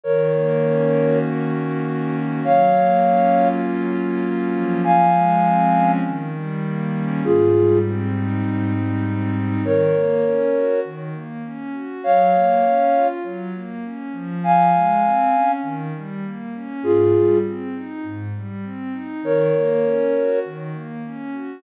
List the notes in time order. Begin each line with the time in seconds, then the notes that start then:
0.04 D#3 A#4 C#5
0.33 A#3
0.62 C#4
0.95 F#4
1.25 D#3
1.54 A#3
1.84 C#4
2.14 F#4
2.42 F#3 C#5 F5
2.74 A#3
3.04 C#4
3.33 F4
3.62 F#3
3.94 A#3
4.22 C#4
4.54 F3
4.84 F5 G#5
5.13 G#3
5.43 C4
5.73 C#4
6.04 D#3
6.35 G3
6.63 A#3
6.95 C#4
7.24 G#2 F4 G#4
7.54 G3
7.84 C4
8.12 D#4
8.42 G#2
8.73 G3
9.03 C4
9.34 D#4
9.62 D#3 A#4 C#5
9.93 A#3
10.23 C#4
10.52 F#4
10.84 D#3
11.13 A#3
11.44 C#4
11.73 F#4
12.04 F#3 C#5 F5
12.34 A#3
12.64 C#4
12.93 F4
13.23 F#3
13.54 A#3
13.83 C#4
14.12 F3
14.44 F5 G#5
14.73 G#3
15.04 C4
15.33 C#4
15.62 D#3
15.95 G3
16.24 A#3
16.54 C#4
16.82 G#2 F4 G#4
17.14 G3
17.45 C4
17.75 D#4
18.03 G#2
18.35 G3
18.63 C4
18.92 D#4
19.22 D#3 A#4 C#5
19.54 A#3
19.82 C#4
20.14 F#4
20.45 D#3
20.73 A#3
21.05 C#4
21.32 F#4